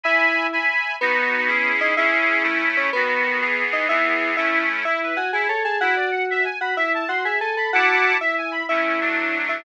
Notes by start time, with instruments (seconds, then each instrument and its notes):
0.04 electric piano 2 E4, accordion E5 G#5 B5
0.52 accordion E5 G#5 B5
1.01 electric piano 2 B3, accordion B3 D#4 F#4
1.47 accordion C#4 E4 G#4
1.81 electric piano 2 D#4
1.97 accordion C#4 E4 G#4, electric piano 2 E4
2.43 accordion A3 C#4 E4
2.77 electric piano 2 C#4
2.93 accordion D#3 B3 F#4, electric piano 2 B3
3.41 accordion E3 B3 G#4
3.73 electric piano 2 D#4
3.89 accordion E3 B3 G#4, electric piano 2 E4
4.37 accordion A3 C#4 E4, electric piano 2 E4
4.85 electric piano 2 E4, accordion E4
5.02 accordion B4
5.16 electric piano 2 F#4, accordion G#5
5.33 accordion E4, electric piano 2 G#4
5.48 electric piano 2 A4, accordion C#5
5.64 electric piano 2 G#4, accordion A5
5.81 accordion E4, electric piano 2 F#4
5.96 accordion D5
6.12 accordion F#5
6.30 accordion E5
6.44 accordion G#5
6.61 electric piano 2 F#4, accordion B5
6.77 electric piano 2 E4, accordion E5
6.94 accordion A5
7.08 electric piano 2 F#4, accordion C6
7.24 electric piano 2 G#4, accordion E5
7.41 electric piano 2 A4, accordion G#5
7.57 electric piano 2 A4, accordion B5
7.73 accordion E4 F#5 A5 D6, electric piano 2 F#4
8.21 electric piano 2 E4, accordion E5
8.38 accordion G#5
8.52 accordion B5
8.69 accordion A3 C#4 E4, electric piano 2 E4
9.01 accordion F#3 A3 D4
9.49 electric piano 2 E4